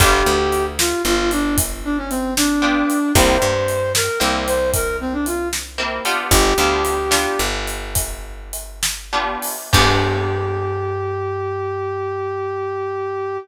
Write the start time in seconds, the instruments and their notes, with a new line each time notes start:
0.00 electric bass (finger) G1, acoustic guitar (steel) B3 D4 F4 G4, brass section G4, kick, closed hi-hat
0.26 electric bass (finger) D2
0.52 closed hi-hat
0.79 brass section F4, snare
1.05 electric bass (finger) G1, brass section F4
1.31 brass section D4, closed hi-hat
1.58 kick, closed hi-hat
1.84 brass section D4
1.97 brass section C#4
2.10 brass section C4, closed hi-hat
2.37 brass section D4, snare
2.62 acoustic guitar (steel) B3 D4 F4 G4
2.90 closed hi-hat
3.15 electric bass (finger) C2, acoustic guitar (steel) A#3 C4 E4 G4, brass section C5, kick, closed hi-hat
3.42 electric bass (finger) G2
3.68 closed hi-hat
3.95 brass section A#4, snare
4.20 electric bass (finger) C2, acoustic guitar (steel) A#3 C4 E4 G4
4.47 brass section C5, closed hi-hat
4.74 brass section A#4, kick, closed hi-hat
5.01 brass section C4
5.13 brass section D4
5.26 brass section F4, closed hi-hat
5.53 snare
5.78 acoustic guitar (steel) A#3 C4 E4 G4
6.05 acoustic guitar (steel) B3 D4 F4 G4, closed hi-hat
6.31 electric bass (finger) G1, brass section G4, kick, closed hi-hat
6.58 electric bass (finger) D2, acoustic guitar (steel) B3 D4 F4 G4
6.85 closed hi-hat
7.11 acoustic guitar (steel) B3 D4 F4 G4, snare
7.39 electric bass (finger) G1
7.67 closed hi-hat
7.95 kick, closed hi-hat
8.53 closed hi-hat
8.83 snare
9.13 acoustic guitar (steel) B3 D4 F4 G4
9.42 open hi-hat
9.73 electric bass (finger) G2, acoustic guitar (steel) B3 D4 F4 G4, brass section G4, kick, crash